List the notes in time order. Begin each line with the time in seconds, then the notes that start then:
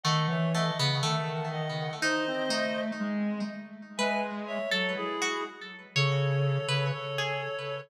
0.03 D#3 A3 D#5 F#5
0.27 E3 C#5 E5
0.53 A3 D#5 F#5
0.79 C#3 B3
1.02 D#3 A3 F#5 A5
1.51 D#5 F#5
2.02 D#4 C5 D#5
2.27 C4
2.49 A3 D#4
3.00 G#3
3.97 G#3 B4 E5 G#5
4.47 C#5 E5
4.70 F#3 A4 C#5
4.96 E4 G#4
5.22 F#4
5.95 C#3 A4 C#5
6.68 C#3 B4
6.92 A4 C#5
7.18 G#4